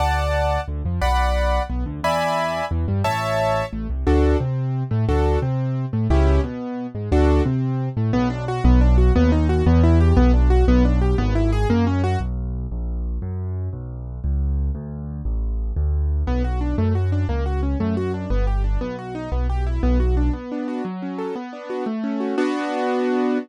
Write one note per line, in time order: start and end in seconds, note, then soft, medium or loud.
0.00 0.58 D2 medium
0.00 0.61 D5 medium
0.00 0.61 F#5 medium
0.00 0.61 A5 medium
0.68 0.82 D2 medium
0.68 0.82 D3 medium
0.85 0.99 F2 medium
0.85 1.00 F3 medium
1.02 1.59 B1 medium
1.02 1.63 D5 medium
1.02 1.63 F#5 medium
1.02 1.63 B5 medium
1.70 1.84 B1 medium
1.70 1.84 B3 medium
1.86 2.01 D2 medium
1.86 2.00 D3 medium
2.03 2.61 E2 medium
2.03 2.65 D5 medium
2.03 2.65 E5 medium
2.03 2.65 G#5 medium
2.03 2.65 B5 medium
2.71 2.85 E2 medium
2.71 2.86 E3 medium
2.88 3.02 G2 medium
2.88 3.02 G3 medium
3.04 3.62 A1 medium
3.04 3.65 C#5 medium
3.04 3.65 E5 medium
3.04 3.65 A5 medium
3.73 3.87 A1 medium
3.73 3.87 A3 medium
3.90 4.04 C2 medium
3.90 4.04 C3 medium
4.07 4.35 D2 loud
4.07 4.37 D4 medium
4.07 4.37 F#4 medium
4.07 4.37 A4 medium
4.40 4.84 C3 medium
4.40 4.83 C4 medium
4.91 5.06 A2 medium
4.91 5.05 A3 medium
5.09 5.37 D2 medium
5.09 5.39 D4 medium
5.09 5.39 F#4 medium
5.09 5.39 A4 medium
5.42 5.86 C3 medium
5.42 5.85 C4 medium
5.93 6.08 A2 medium
5.93 6.07 A3 medium
6.10 6.39 C#2 loud
6.10 6.41 C#4 medium
6.10 6.41 E4 medium
6.10 6.41 G4 medium
6.43 6.87 B2 medium
6.43 6.87 B3 medium
6.95 7.09 G#2 medium
6.95 7.09 G#3 medium
7.12 7.41 D2 medium
7.12 7.43 D4 medium
7.12 7.43 F#4 medium
7.12 7.43 A4 medium
7.45 7.89 C3 medium
7.45 7.89 C4 medium
7.97 8.11 A2 medium
7.97 8.11 A3 medium
8.13 8.60 B1 loud
8.13 8.28 B3 loud
8.30 8.45 D4 medium
8.48 8.63 F#4 medium
8.64 9.11 B1 loud
8.64 8.80 B3 loud
8.81 8.96 D4 medium
8.98 9.13 F#4 medium
9.16 9.62 D#2 loud
9.16 9.31 B3 loud
9.32 9.47 D#4 medium
9.49 9.64 F#4 medium
9.66 10.13 E2 loud
9.66 9.82 B3 loud
9.83 9.99 E4 medium
10.00 10.16 G4 medium
10.17 10.64 B1 loud
10.17 10.32 B3 loud
10.34 10.49 D4 medium
10.50 10.65 F#4 medium
10.68 11.15 B1 loud
10.68 10.83 B3 loud
10.85 11.00 D4 medium
11.01 11.17 G4 medium
11.18 11.65 G#1 loud
11.18 11.33 B3 loud
11.35 11.51 E4 medium
11.52 11.68 G#4 loud
11.70 12.16 F#2 loud
11.70 11.85 A#3 loud
11.87 12.02 C#4 medium
12.04 12.19 F#4 loud
12.20 12.67 B1 medium
12.72 13.18 A#1 medium
13.22 13.69 F#2 medium
13.73 14.20 B1 medium
14.24 14.71 C#2 medium
14.75 15.21 D2 medium
15.25 15.72 A1 medium
15.76 16.23 D2 medium
16.27 16.74 B1 medium
16.27 16.43 B3 medium
16.44 16.60 F#4 medium
16.61 16.76 D4 medium
16.78 17.25 F#2 medium
16.78 16.93 A3 medium
16.95 17.10 F#4 medium
17.12 17.27 D4 medium
17.29 17.75 C#2 medium
17.29 17.44 A#3 medium
17.46 17.61 F#4 medium
17.63 17.78 C#4 medium
17.80 18.27 F#2 medium
17.80 17.95 A3 medium
17.97 18.12 F#4 medium
18.14 18.29 D4 medium
18.30 18.77 G1 medium
18.30 18.45 B3 medium
18.47 18.62 G4 medium
18.64 18.79 D4 medium
18.81 19.28 B1 medium
18.81 18.96 B3 medium
18.99 19.14 F#4 medium
19.15 19.30 D#4 medium
19.32 19.79 B1 medium
19.32 19.47 B3 medium
19.50 19.65 G4 medium
19.67 19.82 E4 medium
19.83 20.30 B1 loud
19.83 19.98 B3 medium
20.00 20.15 F#4 medium
20.17 20.32 D4 medium
20.33 20.82 B3 medium
20.52 20.84 D4 medium
20.68 20.84 F#4 medium
20.85 21.33 F#3 medium
21.02 21.35 C#4 medium
21.18 21.35 A4 medium
21.36 21.84 B3 medium
21.53 21.85 D4 medium
21.70 21.86 F#4 medium
21.86 22.35 A3 medium
22.04 22.36 C#4 medium
22.20 22.36 F#4 medium
22.38 23.38 B3 loud
22.38 23.38 D4 medium
22.38 23.38 F#4 loud